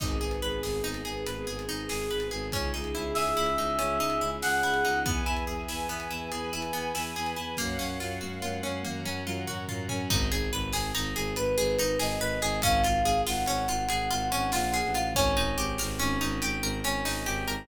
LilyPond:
<<
  \new Staff \with { instrumentName = "Brass Section" } { \time 12/8 \key gis \minor \tempo 4. = 95 r1. | r4. e''2. fis''4. | r1. | r1. |
r1. | r1. | r1. | }
  \new Staff \with { instrumentName = "Flute" } { \time 12/8 \key gis \minor r1. | r1. | r1. | r1. |
r2. b'4. dis''4. | eis''4. fis''1~ fis''8 | r1. | }
  \new Staff \with { instrumentName = "Pizzicato Strings" } { \time 12/8 \key gis \minor dis'8 gis'8 b'8 gis'8 dis'8 gis'8 b'8 gis'8 dis'8 gis'8 b'8 gis'8 | cis'8 dis'8 e'8 gis'8 e'8 dis'8 cis'8 dis'8 e'8 gis'8 e'8 dis'8 | b8 e'8 gis'8 e'8 b8 e'8 gis'8 e'8 b8 e'8 gis'8 e'8 | ais8 cis'8 eis'8 fis'8 eis'8 cis'8 ais8 cis'8 eis'8 fis'8 eis'8 cis'8 |
dis'8 gis'8 b'8 gis'8 dis'8 gis'8 b'8 gis'8 dis'8 gis'8 b'8 gis'8 | cis'8 eis'8 gis'8 eis'8 cis'8 eis'8 gis'8 eis'8 cis'8 eis'8 gis'8 eis'8 | cis'8 dis'8 g'8 ais'8 cis'8 dis'8 g'8 ais'8 cis'8 dis'8 g'8 ais'8 | }
  \new Staff \with { instrumentName = "Violin" } { \clef bass \time 12/8 \key gis \minor gis,,8 gis,,8 gis,,8 gis,,8 gis,,8 gis,,8 gis,,8 gis,,8 gis,,8 gis,,8 gis,,8 gis,,8 | cis,8 cis,8 cis,8 cis,8 cis,8 cis,8 cis,8 cis,8 cis,8 cis,8 cis,8 cis,8 | e,8 e,8 e,8 e,8 e,8 e,8 e,8 e,8 e,8 e,8 e,8 e,8 | fis,8 fis,8 fis,8 fis,8 fis,8 fis,8 fis,8 fis,8 fis,8 fis,8 fis,8 fis,8 |
gis,,8 gis,,8 gis,,8 gis,,8 gis,,8 gis,,8 gis,,8 gis,,8 gis,,8 gis,,8 gis,,8 gis,,8 | gis,,8 gis,,8 gis,,8 gis,,8 gis,,8 gis,,8 gis,,8 gis,,8 gis,,8 ais,,8. a,,8. | gis,,8 gis,,8 gis,,8 gis,,8 gis,,8 gis,,8 gis,,8 gis,,8 gis,,8 gis,,8 gis,,8 gis,,8 | }
  \new Staff \with { instrumentName = "String Ensemble 1" } { \time 12/8 \key gis \minor <b dis' gis'>2. <gis b gis'>2. | <cis' dis' e' gis'>2. <gis cis' dis' gis'>2. | <b' e'' gis''>2. <b' gis'' b''>2. | <ais' cis'' eis'' fis''>2. <ais' cis'' fis'' ais''>2. |
r1. | r1. | r1. | }
  \new DrumStaff \with { instrumentName = "Drums" } \drummode { \time 12/8 <cymc bd>8. hh8. sn8. hh8. hh8. hh8. sn8. hh8. | <hh bd>8. hh8. sn8. hh8. hh8. hh8. sn8. hh8. | <hh bd>8. hh8. sn8. hh8. hh8. hh8. sn8. hh8. | <bd sn>8 sn8 sn8 tommh8 tommh8 tommh8 toml8 toml8 toml8 tomfh8 tomfh8 tomfh8 |
<cymc bd>8 hh8 hh8 sn8 hh8 hh8 hh8 hh8 hh8 sn8 hh8 hh8 | <hh bd>8 hh8 hh8 sn8 hh8 hh8 hh8 hh8 hh8 sn8 hh8 hh8 | <hh bd>8 hh8 hh8 sn8 hh8 hh8 hh8 hh8 hh8 sn8 hh8 hh8 | }
>>